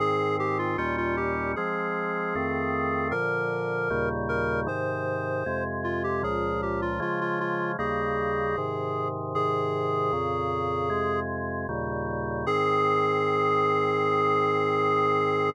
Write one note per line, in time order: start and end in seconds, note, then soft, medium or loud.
0.00 0.77 G#2 loud
0.00 0.77 D#3 loud
0.00 0.77 C4 medium
0.00 0.36 G#4 medium
0.39 0.58 G4 medium
0.59 0.77 F4 medium
0.78 1.55 D#2 medium
0.78 1.55 A#2 medium
0.78 1.55 G3 medium
0.78 1.55 C#4 medium
0.78 0.96 F4 medium
0.97 1.16 F4 medium
1.17 1.52 G4 medium
1.56 2.34 F3 loud
1.56 2.34 G#3 medium
1.56 2.34 C4 medium
1.56 3.08 G#4 medium
2.35 3.13 F2 medium
2.35 3.13 D#3 medium
2.35 3.13 A3 medium
2.35 3.13 C4 loud
3.11 3.89 A#2 medium
3.11 3.89 D3 medium
3.11 3.89 F3 medium
3.11 4.09 A#4 medium
3.90 4.67 D#2 loud
3.90 4.67 A#2 medium
3.90 4.67 C#3 loud
3.90 4.67 G3 medium
4.29 4.60 A#4 medium
4.67 5.44 G#2 medium
4.67 5.44 C3 medium
4.67 5.44 D#3 medium
4.67 5.64 C5 medium
5.46 6.23 F2 medium
5.46 6.23 C3 medium
5.46 6.23 G#3 loud
5.84 6.03 F4 medium
6.04 6.22 G4 medium
6.23 7.00 C#2 loud
6.23 7.00 A#2 medium
6.23 6.99 F3 medium
6.23 6.61 G#4 medium
6.62 6.81 G4 medium
6.82 7.00 F4 medium
7.00 7.77 C#3 medium
7.00 7.77 F3 medium
7.00 7.77 G#3 loud
7.00 7.20 F4 medium
7.21 7.39 F4 medium
7.40 7.72 F4 medium
7.79 8.56 D#2 medium
7.79 8.56 C#3 medium
7.79 8.56 G3 medium
7.79 8.56 A#3 medium
7.79 9.08 G#4 medium
8.58 9.35 G#2 medium
8.58 9.35 C3 medium
8.58 9.35 D#3 medium
9.35 10.12 G#2 medium
9.35 10.12 C3 medium
9.35 10.12 D#3 loud
9.35 11.20 G#4 medium
10.13 10.89 F2 medium
10.13 10.90 A#2 medium
10.13 10.90 C#3 medium
10.90 11.67 F2 loud
10.90 11.67 C3 medium
10.90 11.67 G#3 medium
11.69 12.46 D#2 medium
11.69 12.46 A#2 medium
11.69 12.46 C#3 medium
11.69 12.46 G3 medium
12.46 15.50 G#2 medium
12.46 15.50 D#3 loud
12.46 15.50 C4 loud
12.46 15.50 G#4 loud